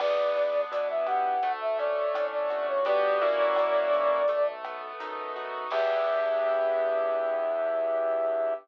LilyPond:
<<
  \new Staff \with { instrumentName = "Flute" } { \time 4/4 \key e \dorian \tempo 4 = 84 d''4 d''16 e''16 fis''8. e''16 d''8. d''8 cis''16 | d''2~ d''8 r4. | e''1 | }
  \new Staff \with { instrumentName = "Acoustic Grand Piano" } { \time 4/4 \key e \dorian b8 d'8 e'8 g'8 a8 cis'8 d'8 fis'8 | <b d' fis' g'>8 <ais cis' e' fis'>4. a8 b8 dis'8 fis'8 | <b d' e' g'>1 | }
  \new Staff \with { instrumentName = "Synth Bass 1" } { \clef bass \time 4/4 \key e \dorian e,4 b,4 d,4 a,8 g,,8~ | g,,4 fis,8 b,,4. fis,4 | e,1 | }
  \new DrumStaff \with { instrumentName = "Drums" } \drummode { \time 4/4 <cymc bd ss>8 hh8 hh8 <hh bd ss>8 <hh bd>8 hh8 <hh ss>8 <hh bd>8 | <hh bd>8 hh8 <hh ss>8 <hh bd>8 <hh bd>8 <hh ss>8 hh8 <hh bd>8 | <cymc bd>4 r4 r4 r4 | }
>>